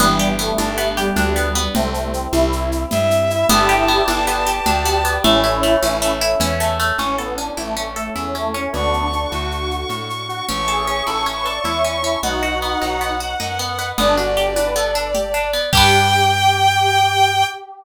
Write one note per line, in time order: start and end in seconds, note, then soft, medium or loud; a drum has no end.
0.00 0.52 G1 medium
0.00 0.33 E3 loud
0.00 0.33 G3 loud
0.00 0.38 B3 medium
0.00 1.73 B3 medium
0.00 1.73 D4 medium
0.00 1.73 G4 medium
0.00 low conga loud
0.00 shaker medium
0.19 0.97 G4 medium
0.19 shaker medium
0.39 0.92 A3 loud
0.39 0.77 B3 medium
0.39 shaker medium
0.58 1.11 G1 medium
0.58 1.16 D4 medium
0.58 high conga medium
0.58 shaker medium
0.78 1.36 B3 medium
0.78 shaker medium
0.97 1.14 G3 loud
0.97 1.71 G4 medium
0.97 shaker medium
1.16 1.69 D2 medium
1.16 1.67 G3 medium
1.16 1.72 D4 medium
1.16 low conga medium
1.16 shaker medium
1.36 1.55 B3 medium
1.36 shaker medium
1.55 1.74 B3 medium
1.55 shaker medium
1.74 2.27 C2 medium
1.74 2.10 A3 medium
1.74 3.47 C4 medium
1.74 2.10 C4 loud
1.74 3.47 E4 medium
1.74 3.47 G4 medium
1.74 low conga loud
1.74 shaker medium
1.94 shaker medium
2.14 2.30 C4 medium
2.14 shaker medium
2.33 2.85 C2 medium
2.33 2.82 E4 loud
2.33 high conga medium
2.33 shaker medium
2.52 shaker medium
2.72 shaker medium
2.91 3.45 G2 medium
2.91 3.46 E5 medium
2.91 low conga medium
2.91 shaker medium
3.11 shaker medium
3.30 3.48 E4 medium
3.30 shaker medium
3.49 4.02 G1 loud
3.49 3.88 B3 medium
3.49 4.12 E4 loud
3.49 4.12 G4 loud
3.49 5.22 B4 medium
3.49 5.22 D5 medium
3.49 5.22 G5 medium
3.49 5.12 A5 medium
3.49 low conga loud
3.49 shaker medium
3.69 4.46 G4 medium
3.69 shaker medium
3.88 4.27 B3 medium
3.88 shaker medium
4.08 4.60 G1 medium
4.08 4.66 D4 medium
4.08 high conga medium
4.08 shaker medium
4.27 4.85 B3 medium
4.27 4.64 G4 medium
4.27 shaker medium
4.47 5.20 G4 medium
4.47 shaker medium
4.66 5.18 D2 medium
4.66 5.21 D4 medium
4.66 5.14 G4 loud
4.66 low conga medium
4.66 shaker medium
4.85 5.04 B3 medium
4.85 shaker medium
5.05 5.23 B3 medium
5.05 shaker medium
5.24 5.77 A1 medium
5.24 5.63 A3 medium
5.24 6.15 C#4 loud
5.24 6.15 E4 loud
5.24 6.98 A4 medium
5.24 6.98 C#5 medium
5.24 6.98 E5 medium
5.24 low conga loud
5.24 shaker medium
5.44 6.21 E4 medium
5.44 shaker medium
5.63 6.01 A3 medium
5.63 shaker medium
5.82 6.35 A1 medium
5.82 6.40 C#4 medium
5.82 high conga medium
5.82 shaker loud
6.02 6.60 A3 medium
6.02 shaker medium
6.21 6.95 E4 medium
6.21 shaker medium
6.40 6.92 E2 medium
6.40 6.96 C#4 medium
6.40 low conga medium
6.40 shaker medium
6.60 6.79 A3 medium
6.60 shaker medium
6.80 6.98 A3 medium
6.80 shaker medium
6.98 7.51 A1 medium
6.98 7.17 C#4 medium
6.98 8.72 C#4 soft
6.98 7.19 C#4 medium
6.98 8.72 E4 soft
6.98 8.72 A4 medium
6.98 low conga medium
6.98 shaker medium
7.18 7.35 B3 medium
7.18 7.38 A4 soft
7.18 shaker medium
7.37 7.57 C#4 soft
7.37 7.55 D4 medium
7.37 shaker medium
7.57 8.10 A1 medium
7.57 7.74 A3 medium
7.57 7.77 E4 soft
7.57 high conga medium
7.57 shaker medium
7.76 7.85 A3 medium
7.76 7.96 C#4 medium
7.76 shaker medium
7.96 8.14 A3 medium
7.96 8.16 A4 soft
7.96 shaker medium
8.15 8.68 E2 medium
8.15 8.34 C#4 medium
8.15 8.35 E4 soft
8.15 low conga medium
8.15 shaker medium
8.35 8.51 A3 medium
8.35 8.54 C#4 soft
8.35 shaker medium
8.54 8.71 C#4 medium
8.54 8.73 C#4 medium
8.54 shaker soft
8.73 9.26 D2 medium
8.73 9.07 B3 medium
8.73 9.07 D4 loud
8.73 10.47 D4 medium
8.73 10.47 F#4 soft
8.73 10.47 A4 medium
8.73 10.45 C#6 soft
8.73 low conga medium
8.73 shaker medium
8.93 shaker medium
9.13 9.32 D4 medium
9.13 shaker medium
9.31 9.85 D2 medium
9.31 9.86 F#4 medium
9.31 high conga medium
9.31 shaker medium
9.51 shaker medium
9.71 shaker medium
9.89 10.42 A2 medium
9.89 low conga medium
9.89 shaker medium
10.10 shaker medium
10.29 10.46 F#4 medium
10.29 shaker medium
10.48 11.02 A1 medium
10.48 10.68 C#4 medium
10.48 12.21 C#5 medium
10.48 12.21 E5 soft
10.48 12.21 A5 medium
10.48 12.18 C#6 medium
10.48 low conga medium
10.48 shaker medium
10.68 10.86 G#4 medium
10.68 10.87 A4 soft
10.68 shaker medium
10.87 11.07 C#4 soft
10.87 11.05 G#4 medium
10.87 shaker soft
11.07 11.60 A1 medium
11.07 11.26 E4 soft
11.07 11.23 A4 medium
11.07 high conga medium
11.07 shaker medium
11.26 11.46 C#4 soft
11.26 shaker medium
11.37 11.46 B4 medium
11.46 11.65 A4 soft
11.46 11.62 D5 medium
11.46 shaker medium
11.64 12.17 E2 medium
11.64 11.95 E4 medium
11.64 11.84 E4 soft
11.64 low conga medium
11.64 shaker medium
11.84 12.03 C#4 soft
11.84 shaker medium
12.03 12.22 C#4 soft
12.03 12.19 E4 medium
12.03 shaker medium
12.23 12.75 B1 medium
12.23 12.43 B3 medium
12.23 13.12 D#4 medium
12.23 13.12 F#4 medium
12.23 13.97 B4 soft
12.23 13.97 D#5 soft
12.23 13.87 F#5 medium
12.23 13.97 F#5 soft
12.23 low conga medium
12.23 shaker medium
12.43 12.62 F#4 soft
12.43 shaker medium
12.62 12.82 B3 soft
12.62 shaker medium
12.82 13.35 B1 medium
12.82 13.01 D#4 soft
12.82 high conga medium
12.82 shaker medium
13.01 13.20 B3 soft
13.01 shaker medium
13.20 13.40 F#4 soft
13.20 shaker medium
13.40 13.93 F#2 medium
13.40 13.59 D#4 soft
13.40 low conga medium
13.40 shaker medium
13.59 13.78 B3 soft
13.59 shaker medium
13.78 13.97 B3 soft
13.78 shaker medium
13.97 15.59 G1 medium
13.97 14.16 B3 medium
13.97 14.17 D4 loud
13.97 15.65 D5 medium
13.97 low conga loud
13.97 shaker medium
14.17 14.35 D4 soft
14.17 14.34 F#4 medium
14.17 shaker medium
14.37 14.53 G4 medium
14.37 14.54 G4 medium
14.37 shaker medium
14.56 14.74 D4 medium
14.56 14.74 B4 medium
14.56 high conga medium
14.56 shaker medium
14.75 14.93 B3 medium
14.75 15.09 A4 medium
14.75 shaker medium
14.95 15.13 D4 medium
14.95 shaker medium
15.15 15.32 G4 soft
15.15 low conga medium
15.15 shaker medium
15.34 15.51 D4 medium
15.34 shaker medium
15.53 15.71 B3 medium
15.53 shaker medium
15.72 17.44 G2 medium
15.72 17.44 D4 medium
15.72 17.44 G4 loud
15.72 17.44 G4 medium
15.72 17.45 G5 loud
15.72 kick loud
15.72 crash loud
15.77 17.44 B3 medium